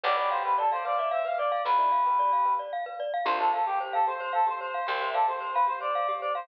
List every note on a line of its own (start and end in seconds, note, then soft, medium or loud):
0.04 1.52 B1 loud
0.04 0.59 G4 medium
0.04 0.16 B4 loud
0.04 0.59 B4 loud
0.04 0.16 D5 medium
0.17 0.29 D5 medium
0.17 0.30 D5 medium
0.31 0.43 C5 medium
0.31 0.43 F5 medium
0.45 0.55 B4 medium
0.45 0.57 B4 medium
0.58 0.70 A4 medium
0.58 0.70 D5 medium
0.72 0.84 C5 medium
0.72 0.82 D5 medium
0.72 0.84 F5 medium
0.85 0.97 B4 medium
0.85 1.08 D5 medium
0.85 0.97 F5 medium
0.98 1.10 D5 medium
0.98 1.11 E5 medium
1.11 1.23 C5 medium
1.11 1.25 E5 medium
1.11 1.23 F5 medium
1.25 1.37 B4 medium
1.25 1.37 F5 medium
1.25 1.38 F5 medium
1.38 1.62 D5 medium
1.38 1.51 D5 medium
1.52 1.65 D5 medium
1.52 1.64 F5 medium
1.65 3.14 B1 medium
1.65 1.76 F4 medium
1.65 1.77 B4 medium
1.65 2.53 B4 medium
1.78 1.92 E4 medium
1.78 1.90 D5 medium
1.92 2.04 F5 medium
2.05 2.52 G4 medium
2.05 2.19 B4 medium
2.19 2.31 D5 medium
2.33 2.45 F5 medium
2.45 2.57 B4 medium
2.59 2.71 D5 medium
2.73 2.85 F5 medium
2.86 2.98 B4 medium
3.00 3.12 D5 medium
3.14 3.26 F5 medium
3.25 4.74 C2 medium
3.25 3.51 D4 medium
3.25 3.51 F4 medium
3.25 3.38 G4 loud
3.25 3.38 C5 medium
3.39 3.51 A4 medium
3.39 3.53 C5 medium
3.53 3.66 A4 medium
3.53 3.65 F5 medium
3.66 3.79 G4 medium
3.80 4.05 G4 medium
3.80 3.92 C5 medium
3.93 4.06 A4 medium
3.93 4.05 F5 medium
4.07 4.20 G4 medium
4.07 4.32 C5 medium
4.07 4.41 C5 medium
4.20 4.32 C5 medium
4.33 4.47 A4 medium
4.33 4.45 F5 medium
4.47 4.59 G4 medium
4.47 4.86 C5 medium
4.47 4.60 C5 medium
4.60 4.86 C5 medium
4.60 4.73 C5 medium
4.74 4.86 F5 medium
4.87 6.36 C2 medium
4.87 5.00 G4 medium
4.87 4.98 C5 loud
4.87 5.09 C5 medium
5.01 5.14 C5 medium
5.01 5.13 E5 loud
5.14 5.27 A4 medium
5.14 5.25 D5 medium
5.14 5.26 F5 medium
5.28 5.40 G4 medium
5.28 5.52 C5 medium
5.28 6.16 C5 medium
5.40 5.53 C5 medium
5.54 5.64 B4 medium
5.54 5.68 F5 medium
5.67 5.79 G4 medium
5.67 5.79 C5 medium
5.80 5.93 C5 medium
5.80 6.13 D5 medium
5.95 6.07 F5 medium
6.08 6.21 G4 medium
6.21 6.34 C5 medium
6.21 6.33 D5 medium
6.35 6.48 C5 medium
6.35 6.47 F5 medium